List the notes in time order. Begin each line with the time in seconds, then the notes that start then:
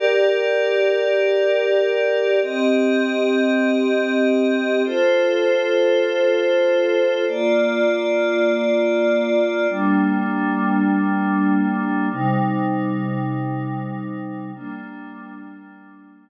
0.00 G4 A#4 D5
2.42 C4 G4 D#5
4.85 F4 A4 C5
7.27 A#3 F4 D5
9.69 G3 A#3 D4
12.11 C3 G3 D#4
14.54 G3 A#3 D4